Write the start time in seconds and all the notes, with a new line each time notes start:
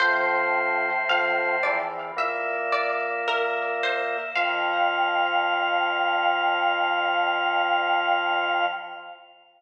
0.00 F2 A2 F3 C5
1.09 F2 F3 F5
1.63 E2 E3 D5
2.16 A#2 A#3 E5
2.72 D5
3.27 A#4 E5
3.83 C5
4.35 F2 F3 F5